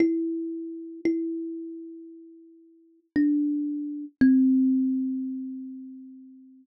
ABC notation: X:1
M:4/4
L:1/8
Q:1/4=57
K:C
V:1 name="Kalimba"
E2 E4 D2 | C8 |]